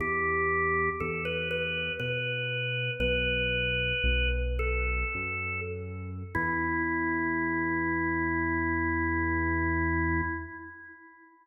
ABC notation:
X:1
M:3/4
L:1/16
Q:1/4=60
K:Em
V:1 name="Drawbar Organ"
G4 A B B2 B4 | "^rit." B6 A4 z2 | E12 |]
V:2 name="Synth Bass 1" clef=bass
E,,4 E,,4 B,,4 | "^rit." B,,,4 B,,,4 F,,4 | E,,12 |]